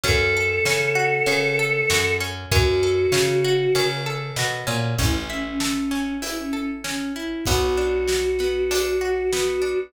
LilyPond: <<
  \new Staff \with { instrumentName = "Choir Aahs" } { \time 4/4 \key a \mixolydian \tempo 4 = 97 a'1 | fis'2~ fis'8 r4. | e'16 r16 cis'16 cis'16 cis'4 e'16 cis'16 cis'16 r16 cis'8 e'8 | fis'1 | }
  \new Staff \with { instrumentName = "Acoustic Guitar (steel)" } { \time 4/4 \key a \mixolydian cis'8 a'8 cis'8 fis'8 cis'8 a'8 fis'8 cis'8 | cis'8 a'8 cis'8 fis'8 cis'8 a'8 fis'8 cis'8 | cis'8 e'8 a'8 cis'8 e'8 a'8 cis'8 e'8 | b8 d'8 fis'8 b8 d'8 fis'8 b8 d'8 | }
  \new Staff \with { instrumentName = "Electric Bass (finger)" } { \clef bass \time 4/4 \key a \mixolydian fis,4 cis4 cis4 fis,4 | fis,4 cis4 cis4 b,8 ais,8 | a,,1 | b,,1 | }
  \new DrumStaff \with { instrumentName = "Drums" } \drummode { \time 4/4 <bd cymr>4 sn4 cymr4 sn4 | <bd cymr>4 sn4 cymr4 sn4 | <hh bd>4 sn8 sn8 hh4 sn4 | <hh bd>4 sn8 sn8 hh4 sn4 | }
>>